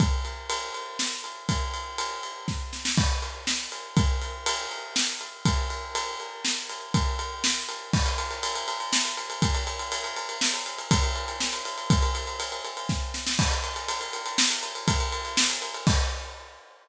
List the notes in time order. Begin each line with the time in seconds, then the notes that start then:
0.00 kick, ride
0.25 ride
0.50 ride
0.74 ride
0.99 snare
1.24 ride
1.49 kick, ride
1.74 ride
1.98 ride
2.23 ride
2.48 kick, snare
2.73 snare
2.85 snare
2.98 kick, crash
3.22 ride
3.47 snare
3.72 ride
3.97 kick, ride
4.21 ride
4.46 ride
4.71 ride
4.96 snare
5.21 ride
5.45 kick, ride
5.70 ride
5.95 ride
6.20 ride
6.45 snare
6.69 ride
6.94 kick, ride
7.19 ride
7.44 snare
7.69 ride
7.93 kick, crash
8.06 ride
8.18 ride
8.31 ride
8.43 ride
8.55 ride
8.68 ride
8.80 ride
8.93 snare
9.05 ride
9.17 ride
9.30 ride
9.42 kick, ride
9.55 ride
9.67 ride
9.79 ride
9.92 ride
10.04 ride
10.16 ride
10.29 ride
10.41 snare
10.54 ride
10.66 ride
10.78 ride
10.91 kick, ride
11.03 ride
11.16 ride
11.28 ride
11.40 snare
11.53 ride
11.65 ride
11.78 ride
11.90 kick, ride
12.02 ride
12.15 ride
12.27 ride
12.40 ride
12.52 ride
12.65 ride
12.77 ride
12.89 kick, snare
13.14 snare
13.27 snare
13.39 kick, crash
13.51 ride
13.64 ride
13.76 ride
13.88 ride
14.01 ride
14.13 ride
14.26 ride
14.38 snare
14.50 ride
14.63 ride
14.75 ride
14.88 kick, ride
15.00 ride
15.12 ride
15.25 ride
15.37 snare
15.50 ride
15.62 ride
15.74 ride
15.87 kick, crash